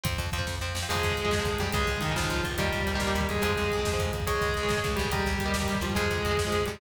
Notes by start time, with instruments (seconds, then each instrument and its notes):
0.04 electric bass (finger) F2, overdriven guitar F3 C4, kick, closed hi-hat
0.13 kick
0.18 electric bass (finger) F2, kick, closed hi-hat
0.26 kick
0.32 electric bass (finger) F2, overdriven guitar F3 C4, kick, closed hi-hat
0.38 overdriven guitar F3 C4, kick
0.47 electric bass (finger) F2, kick, snare
0.61 electric bass (finger) F2, overdriven guitar F3 C4
0.75 electric bass (finger) F2, snare
0.83 overdriven guitar F3 C4
0.89 electric bass (finger) F2, overdriven guitar C3 F3 G#3, distortion guitar G#3 G#4, crash
0.95 kick
1.03 electric bass (finger) F2, kick, closed hi-hat
1.11 kick
1.17 electric bass (finger) F2, kick, closed hi-hat
1.24 overdriven guitar C3 F3 G#3, kick
1.31 electric bass (finger) F2, kick, snare
1.39 overdriven guitar C3 F3 G#3, kick
1.45 electric bass (finger) F2, kick, closed hi-hat
1.53 kick
1.58 electric bass (finger) F2, distortion guitar G3 G4, kick, closed hi-hat
1.66 kick
1.73 electric bass (finger) C#2, overdriven guitar C#3 G#3, distortion guitar G#3 G#4, kick, closed hi-hat
1.80 kick
1.87 electric bass (finger) C#2, kick, closed hi-hat
1.97 kick
2.01 electric bass (finger) C#2, distortion guitar D#3 D#4, kick, closed hi-hat
2.09 overdriven guitar C#3 G#3, kick
2.16 electric bass (finger) C#2, distortion guitar F3 F4, kick, snare
2.23 overdriven guitar C#3 G#3, kick
2.30 electric bass (finger) C#2, kick, closed hi-hat
2.36 kick
2.44 electric bass (finger) C#2, kick, closed hi-hat
2.51 kick
2.58 electric bass (finger) D#2, overdriven guitar D#3 G3 A#3, distortion guitar G3 G4, kick, closed hi-hat
2.65 kick
2.73 electric bass (finger) D#2, kick, closed hi-hat
2.81 kick
2.87 electric bass (finger) D#2, kick, closed hi-hat
2.94 overdriven guitar D#3 G3 A#3, kick
3.00 electric bass (finger) D#2, kick, snare
3.07 overdriven guitar D#3 G3 A#3, kick
3.15 electric bass (finger) D#2, kick, closed hi-hat
3.21 kick
3.29 electric bass (finger) D#2, distortion guitar G#3 G#4, kick, closed hi-hat
3.35 kick
3.42 electric bass (finger) F2, overdriven guitar F3 G#3 C4, distortion guitar G#3 G#4, closed hi-hat
3.49 kick
3.56 electric bass (finger) F2, kick, closed hi-hat
3.64 kick
3.70 electric bass (finger) F2, kick, closed hi-hat
3.78 overdriven guitar F3 G#3 C4, kick
3.85 electric bass (finger) F2, kick, snare
3.92 overdriven guitar F3 G#3 C4, kick
3.99 electric bass (finger) F2, kick, closed hi-hat
4.05 kick
4.13 electric bass (finger) F2, kick, closed hi-hat
4.20 kick
4.27 electric bass (finger) C#2, distortion guitar G#3 G#4, overdriven guitar G#4 C#5, kick, closed hi-hat
4.34 kick
4.41 electric bass (finger) C#2, kick, closed hi-hat
4.49 kick
4.54 electric bass (finger) C#2, kick, closed hi-hat
4.63 overdriven guitar G#4 C#5, kick
4.68 electric bass (finger) C#2, kick, snare
4.77 overdriven guitar G#4 C#5, kick
4.84 electric bass (finger) C#2, kick
4.91 kick
4.96 electric bass (finger) C#2, distortion guitar G3 G4, kick, closed hi-hat
5.05 kick
5.11 electric bass (finger) D#2, distortion guitar G3 G4, overdriven guitar G4 A#4 D#5, kick, closed hi-hat
5.19 kick
5.26 electric bass (finger) D#2, kick, closed hi-hat
5.33 kick
5.39 electric bass (finger) D#2, kick, closed hi-hat
5.46 overdriven guitar G4 A#4 D#5, kick
5.54 electric bass (finger) D#2, kick, snare
5.60 overdriven guitar G4 A#4 D#5, kick
5.68 electric bass (finger) D#2, kick, closed hi-hat
5.75 kick
5.81 electric bass (finger) D#2, distortion guitar F3 F4, kick, closed hi-hat
5.90 kick
5.95 electric bass (finger) F2, distortion guitar G#3 G#4, overdriven guitar F4 G#4 C5, kick, closed hi-hat
6.04 kick
6.10 electric bass (finger) F2, kick, closed hi-hat
6.18 kick
6.25 electric bass (finger) F2, kick, closed hi-hat
6.31 overdriven guitar F4 G#4 C5, kick
6.37 electric bass (finger) F2, kick, snare
6.45 overdriven guitar F4 G#4 C5, kick
6.52 electric bass (finger) F2, kick, closed hi-hat
6.61 kick
6.66 electric bass (finger) F2, distortion guitar G3 G4, kick, closed hi-hat
6.75 kick